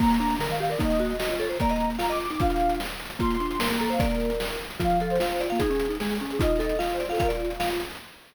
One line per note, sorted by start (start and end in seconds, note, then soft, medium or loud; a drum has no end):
0.00 0.18 A#3 loud
0.00 0.35 A#3 medium
0.00 0.35 A#5 loud
0.00 kick loud
0.00 crash loud
0.05 closed hi-hat medium
0.10 closed hi-hat medium
0.14 closed hi-hat medium
0.20 0.39 D4 loud
0.20 closed hi-hat medium
0.25 closed hi-hat medium
0.30 closed hi-hat medium
0.35 closed hi-hat medium
0.39 0.48 D3 medium
0.39 0.58 A#4 medium
0.39 0.48 A#5 medium
0.39 snare loud
0.45 0.75 D#3 medium
0.45 closed hi-hat medium
0.50 0.59 F5 medium
0.50 closed hi-hat medium
0.55 closed hi-hat medium
0.60 0.69 G4 loud
0.60 0.69 F5 medium
0.64 closed hi-hat medium
0.70 0.79 A#4 medium
0.70 0.78 D5 loud
0.70 closed hi-hat medium
0.75 0.98 D#4 loud
0.75 closed hi-hat medium
0.79 1.13 A#3 medium
0.79 1.16 D#5 loud
0.79 kick loud
0.79 closed hi-hat loud
0.85 closed hi-hat medium
0.90 closed hi-hat medium
0.95 closed hi-hat medium
0.99 1.17 F#4 loud
0.99 closed hi-hat medium
1.05 closed hi-hat medium
1.10 closed hi-hat medium
1.15 closed hi-hat medium
1.19 1.30 F#4 medium
1.19 1.36 D#5 medium
1.19 1.28 D#5 medium
1.19 snare loud
1.25 1.57 F4 medium
1.25 closed hi-hat medium
1.30 1.39 C#5 medium
1.30 closed hi-hat medium
1.35 1.47 C#5 medium
1.35 closed hi-hat medium
1.40 1.48 A4 loud
1.40 closed hi-hat medium
1.45 closed hi-hat medium
1.49 1.58 A#4 medium
1.49 1.58 C5 medium
1.49 closed hi-hat medium
1.55 1.93 A#5 loud
1.55 closed hi-hat medium
1.60 1.98 A#3 medium
1.60 1.70 D5 loud
1.60 kick loud
1.60 closed hi-hat loud
1.65 closed hi-hat medium
1.69 1.90 D#5 loud
1.69 closed hi-hat medium
1.76 closed hi-hat medium
1.80 closed hi-hat medium
1.84 closed hi-hat medium
1.90 closed hi-hat medium
1.95 2.07 F5 medium
1.95 closed hi-hat medium
1.99 2.27 F4 medium
1.99 2.10 A#5 medium
1.99 snare loud
2.05 closed hi-hat medium
2.10 2.19 D#5 loud
2.10 2.19 D6 medium
2.10 closed hi-hat medium
2.16 closed hi-hat medium
2.20 2.29 D6 medium
2.20 closed hi-hat medium
2.25 closed hi-hat medium
2.30 2.40 D#4 medium
2.30 2.40 D6 medium
2.30 closed hi-hat medium
2.34 closed hi-hat medium
2.40 2.80 D4 loud
2.40 2.80 F4 medium
2.40 2.76 F5 loud
2.40 kick loud
2.40 closed hi-hat loud
2.45 closed hi-hat medium
2.50 closed hi-hat medium
2.56 closed hi-hat medium
2.60 closed hi-hat medium
2.65 closed hi-hat medium
2.69 closed hi-hat medium
2.75 closed hi-hat medium
2.80 snare loud
2.85 closed hi-hat medium
2.90 closed hi-hat medium
2.95 closed hi-hat medium
3.00 closed hi-hat medium
3.05 closed hi-hat medium
3.10 closed hi-hat medium
3.15 closed hi-hat medium
3.19 3.37 A#3 loud
3.19 3.57 F4 medium
3.19 3.59 C6 loud
3.19 kick loud
3.19 closed hi-hat medium
3.25 closed hi-hat medium
3.30 closed hi-hat medium
3.35 closed hi-hat medium
3.40 3.58 D4 medium
3.40 closed hi-hat medium
3.45 closed hi-hat medium
3.51 closed hi-hat medium
3.55 closed hi-hat medium
3.59 3.68 A#3 medium
3.59 3.78 A#4 medium
3.59 3.69 C6 medium
3.59 snare loud
3.65 closed hi-hat medium
3.71 3.98 A#3 medium
3.71 3.81 A#5 medium
3.71 closed hi-hat medium
3.75 closed hi-hat medium
3.80 3.89 A4 medium
3.80 3.90 A#5 medium
3.80 closed hi-hat medium
3.86 closed hi-hat medium
3.90 4.00 C5 loud
3.90 3.99 F5 medium
3.90 closed hi-hat medium
3.94 closed hi-hat medium
3.99 4.31 A#3 medium
3.99 4.08 A#4 loud
3.99 4.49 D5 loud
3.99 kick loud
3.99 closed hi-hat loud
4.05 closed hi-hat medium
4.09 4.56 A#4 medium
4.09 closed hi-hat medium
4.15 closed hi-hat medium
4.20 closed hi-hat medium
4.25 closed hi-hat medium
4.30 closed hi-hat medium
4.35 closed hi-hat medium
4.40 snare loud
4.45 closed hi-hat medium
4.50 closed hi-hat medium
4.55 closed hi-hat medium
4.60 closed hi-hat medium
4.65 closed hi-hat medium
4.70 closed hi-hat medium
4.75 closed hi-hat medium
4.80 5.18 F3 medium
4.80 4.99 F4 loud
4.80 5.09 F5 loud
4.80 kick loud
4.80 closed hi-hat loud
4.85 closed hi-hat medium
4.90 closed hi-hat medium
4.96 closed hi-hat medium
5.00 5.18 A4 medium
5.00 closed hi-hat medium
5.05 closed hi-hat medium
5.10 5.39 C5 loud
5.10 closed hi-hat medium
5.15 closed hi-hat medium
5.20 5.47 F4 medium
5.20 5.40 F5 medium
5.20 snare loud
5.25 closed hi-hat medium
5.30 closed hi-hat medium
5.36 closed hi-hat medium
5.40 5.58 F4 medium
5.40 5.49 D5 medium
5.40 closed hi-hat medium
5.45 closed hi-hat medium
5.50 5.61 A#3 medium
5.50 5.59 F5 medium
5.50 closed hi-hat medium
5.55 closed hi-hat medium
5.59 5.70 D#4 medium
5.59 5.97 G#4 loud
5.59 5.94 G#4 loud
5.59 kick loud
5.59 closed hi-hat loud
5.66 closed hi-hat medium
5.70 5.87 C#4 medium
5.70 closed hi-hat medium
5.75 closed hi-hat medium
5.79 closed hi-hat loud
5.85 closed hi-hat medium
5.89 5.98 D#4 medium
5.89 closed hi-hat medium
5.95 closed hi-hat medium
6.00 6.19 G#3 medium
6.00 6.08 G#4 medium
6.00 6.18 G#4 medium
6.00 snare loud
6.05 closed hi-hat medium
6.09 6.17 G#4 medium
6.09 closed hi-hat medium
6.15 closed hi-hat medium
6.20 6.40 C#4 medium
6.20 6.29 G#4 medium
6.20 closed hi-hat medium
6.25 closed hi-hat medium
6.30 6.40 G#4 medium
6.30 closed hi-hat medium
6.35 6.74 D#4 medium
6.35 closed hi-hat medium
6.40 6.60 F4 loud
6.40 6.76 D#5 loud
6.40 kick loud
6.40 closed hi-hat loud
6.45 closed hi-hat medium
6.50 closed hi-hat medium
6.55 6.79 A4 loud
6.55 closed hi-hat medium
6.60 closed hi-hat medium
6.64 closed hi-hat medium
6.69 closed hi-hat medium
6.75 7.04 F4 medium
6.75 6.96 F5 medium
6.75 closed hi-hat medium
6.80 6.89 D#5 medium
6.80 snare medium
6.85 closed hi-hat medium
6.90 6.99 C5 medium
6.90 closed hi-hat medium
6.95 closed hi-hat medium
7.00 7.09 C5 medium
7.00 7.08 D5 medium
7.00 closed hi-hat medium
7.05 7.18 F4 medium
7.05 closed hi-hat medium
7.10 7.19 A4 medium
7.10 7.19 F5 medium
7.10 closed hi-hat medium
7.15 7.50 F4 medium
7.15 open hi-hat medium
7.19 7.30 A#4 loud
7.19 7.28 F5 loud
7.19 kick loud
7.19 closed hi-hat loud
7.25 7.53 D5 medium
7.25 closed hi-hat medium
7.30 7.40 F4 medium
7.30 closed hi-hat medium
7.35 closed hi-hat medium
7.40 7.80 F4 medium
7.40 closed hi-hat medium
7.45 closed hi-hat medium
7.50 closed hi-hat medium
7.55 closed hi-hat medium
7.60 7.69 F5 loud
7.60 snare loud
7.65 closed hi-hat medium
7.70 closed hi-hat medium
7.75 closed hi-hat medium
7.80 closed hi-hat medium
7.85 closed hi-hat medium
7.90 closed hi-hat medium
7.95 closed hi-hat medium